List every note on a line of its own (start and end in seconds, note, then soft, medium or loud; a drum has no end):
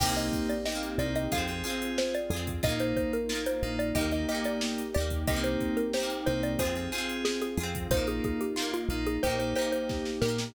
0.00 0.30 C2 loud
0.00 0.53 A#3 loud
0.00 1.30 A#3 loud
0.00 0.53 C4 loud
0.00 1.30 C4 loud
0.00 0.53 D#4 loud
0.00 1.30 D#4 medium
0.00 0.60 D#4 loud
0.00 0.53 G4 medium
0.00 0.60 G4 loud
0.00 1.30 G4 medium
0.00 0.16 G5 loud
0.00 kick loud
0.00 crash loud
0.06 0.60 A#3 loud
0.06 0.60 C4 loud
0.17 0.47 D#5 loud
0.17 closed hi-hat medium
0.33 kick medium
0.33 closed hi-hat medium
0.49 0.65 D5 loud
0.49 closed hi-hat medium
0.66 1.27 D#4 medium
0.66 1.27 G4 medium
0.66 0.98 D#5 medium
0.66 snare loud
0.72 1.27 A#3 loud
0.72 1.27 C4 medium
0.83 closed hi-hat medium
0.98 1.28 C2 medium
0.98 1.25 A#3 medium
0.98 1.25 C4 medium
0.98 1.25 D#4 medium
0.98 1.25 G4 medium
0.98 1.14 D5 medium
0.98 closed hi-hat medium
1.16 1.31 D#5 loud
1.16 closed hi-hat medium
1.32 1.63 F2 loud
1.32 1.45 C4 medium
1.32 2.63 C4 medium
1.32 1.45 F4 medium
1.32 2.63 F4 loud
1.32 1.62 F4 loud
1.32 1.45 G#4 medium
1.32 1.62 G#4 loud
1.32 2.63 G#4 medium
1.32 1.89 F5 medium
1.32 kick medium
1.32 closed hi-hat loud
1.38 1.62 C4 loud
1.48 1.62 C4 medium
1.48 1.62 F4 medium
1.48 1.62 G#4 medium
1.48 closed hi-hat medium
1.64 2.17 C4 medium
1.64 2.17 F4 medium
1.64 2.24 F4 medium
1.64 2.24 G#4 loud
1.64 2.17 G#4 medium
1.64 closed hi-hat medium
1.70 2.24 C4 medium
1.82 closed hi-hat medium
1.98 2.14 C5 loud
1.98 snare loud
2.15 2.63 D5 loud
2.15 closed hi-hat medium
2.30 2.60 F2 medium
2.30 2.61 F4 medium
2.30 2.61 G#4 medium
2.30 closed hi-hat medium
2.36 2.61 C4 loud
2.47 kick medium
2.47 closed hi-hat medium
2.63 2.94 A#1 loud
2.63 3.17 A#3 medium
2.63 3.95 A#3 loud
2.63 3.17 D#4 loud
2.63 3.95 D#4 loud
2.63 3.23 D#4 loud
2.63 3.23 F4 loud
2.63 3.17 F4 medium
2.63 3.95 F4 medium
2.63 2.79 D#5 loud
2.63 kick loud
2.63 closed hi-hat medium
2.69 3.23 A#3 loud
2.80 2.96 C5 loud
2.80 closed hi-hat medium
2.97 3.12 C5 loud
2.97 kick medium
2.97 closed hi-hat medium
3.13 3.44 A#4 loud
3.13 closed hi-hat medium
3.29 3.90 D#4 loud
3.29 3.90 F4 loud
3.29 snare loud
3.35 3.90 A#3 medium
3.46 3.76 C5 loud
3.46 closed hi-hat medium
3.63 3.92 A#1 medium
3.63 3.89 A#3 medium
3.63 3.89 D#4 medium
3.63 3.89 F4 medium
3.63 closed hi-hat medium
3.79 3.95 D5 loud
3.79 closed hi-hat medium
3.95 4.25 D#2 loud
3.95 4.09 A#3 medium
3.95 5.27 A#3 medium
3.95 4.09 D#4 loud
3.95 5.27 D#4 medium
3.95 4.25 D#4 loud
3.95 4.25 G4 loud
3.95 4.09 G4 medium
3.95 5.27 G4 loud
3.95 4.11 D#5 loud
3.95 kick medium
3.95 closed hi-hat loud
4.01 4.25 A#3 loud
4.11 4.25 A#3 medium
4.11 4.25 D#4 medium
4.11 4.25 G4 medium
4.11 4.28 D#5 loud
4.11 closed hi-hat medium
4.29 4.81 A#3 medium
4.29 4.81 D#4 medium
4.29 4.89 D#4 loud
4.29 4.89 G4 loud
4.29 4.81 G4 medium
4.29 4.45 D#5 medium
4.29 closed hi-hat medium
4.34 4.89 A#3 loud
4.44 4.86 D5 loud
4.44 closed hi-hat medium
4.61 snare loud
4.78 closed hi-hat medium
4.94 5.26 D#2 loud
4.94 5.25 D#4 loud
4.94 5.25 G4 medium
4.94 5.22 D5 medium
4.94 closed hi-hat medium
5.00 5.25 A#3 loud
5.10 kick medium
5.10 closed hi-hat medium
5.27 5.57 C2 loud
5.27 6.58 A#3 medium
5.27 5.80 A#3 loud
5.27 6.58 C4 medium
5.27 5.80 C4 loud
5.27 6.58 D#4 medium
5.27 5.80 D#4 medium
5.27 5.88 D#4 loud
5.27 6.58 G4 loud
5.27 5.88 G4 loud
5.27 5.80 G4 medium
5.27 5.43 D#5 loud
5.27 kick loud
5.27 closed hi-hat loud
5.33 5.88 A#3 loud
5.33 5.88 C4 loud
5.44 5.76 C5 loud
5.44 closed hi-hat medium
5.61 kick medium
5.61 closed hi-hat medium
5.77 5.92 A#4 loud
5.77 closed hi-hat medium
5.93 6.55 D#4 loud
5.93 6.55 G4 loud
5.93 6.21 C5 loud
5.93 snare loud
6.00 6.55 A#3 loud
6.00 6.55 C4 loud
6.10 closed hi-hat medium
6.26 6.57 C2 loud
6.26 6.53 A#3 medium
6.26 6.53 C4 medium
6.26 6.53 D#4 medium
6.26 6.53 G4 medium
6.26 6.42 C5 loud
6.26 closed hi-hat medium
6.43 6.59 D5 loud
6.43 closed hi-hat medium
6.59 6.89 F2 loud
6.59 6.73 C4 loud
6.59 7.90 C4 medium
6.59 6.73 F4 loud
6.59 7.90 F4 loud
6.59 6.90 F4 loud
6.59 6.90 G#4 loud
6.59 6.73 G#4 loud
6.59 7.90 G#4 medium
6.59 7.15 C5 loud
6.59 kick medium
6.59 closed hi-hat loud
6.65 6.90 C4 loud
6.75 6.89 C4 medium
6.75 6.89 F4 medium
6.75 6.89 G#4 medium
6.75 closed hi-hat medium
6.92 7.45 C4 medium
6.92 7.45 F4 medium
6.92 7.53 F4 loud
6.92 7.53 G#4 loud
6.92 7.45 G#4 loud
6.92 closed hi-hat medium
6.98 7.53 C4 loud
7.09 closed hi-hat medium
7.25 7.40 G#4 loud
7.25 snare loud
7.41 7.88 G#4 loud
7.41 closed hi-hat medium
7.57 7.87 F2 medium
7.57 7.88 F4 loud
7.57 7.88 G#4 loud
7.57 closed hi-hat medium
7.63 7.88 C4 loud
7.75 kick medium
7.75 closed hi-hat medium
7.91 8.20 A#1 loud
7.91 9.21 A#3 medium
7.91 8.44 A#3 medium
7.91 9.21 D#4 medium
7.91 8.44 D#4 loud
7.91 8.51 D#4 loud
7.91 8.51 F4 loud
7.91 9.21 F4 medium
7.91 8.44 F4 medium
7.91 8.07 C5 loud
7.91 kick loud
7.91 closed hi-hat loud
7.97 8.51 A#3 loud
8.07 8.23 G#4 loud
8.07 closed hi-hat medium
8.24 8.40 G#4 medium
8.24 kick loud
8.24 closed hi-hat medium
8.41 8.73 G4 medium
8.41 closed hi-hat medium
8.56 9.17 D#4 loud
8.56 9.17 F4 loud
8.56 snare loud
8.62 9.17 A#3 medium
8.74 9.05 F4 loud
8.74 closed hi-hat medium
8.89 9.18 A#1 loud
8.89 9.16 A#3 medium
8.89 9.16 D#4 medium
8.89 9.16 F4 medium
8.89 closed hi-hat medium
9.06 9.22 G#4 loud
9.06 closed hi-hat medium
9.23 9.54 A#1 loud
9.23 9.36 A#3 medium
9.23 10.54 A#3 loud
9.23 9.36 D#4 loud
9.23 10.54 D#4 medium
9.23 9.54 D#4 loud
9.23 9.36 G4 medium
9.23 10.54 G4 loud
9.23 9.54 G4 loud
9.23 9.39 C5 loud
9.23 kick medium
9.23 closed hi-hat medium
9.30 9.54 A#3 loud
9.39 9.53 A#3 medium
9.39 9.53 D#4 medium
9.39 9.53 G4 medium
9.39 9.55 C5 medium
9.39 closed hi-hat medium
9.55 10.09 A#3 medium
9.55 10.09 D#4 medium
9.55 10.16 D#4 loud
9.55 10.16 G4 medium
9.55 10.09 G4 medium
9.55 9.72 C5 loud
9.55 closed hi-hat medium
9.61 10.16 A#3 loud
9.72 10.18 C5 loud
9.72 closed hi-hat medium
9.89 kick medium
9.89 snare medium
10.05 snare medium
10.21 10.51 A#2 medium
10.21 10.53 D#4 medium
10.21 10.53 G4 loud
10.21 10.48 A#4 loud
10.21 snare loud
10.28 10.53 A#3 loud
10.38 snare loud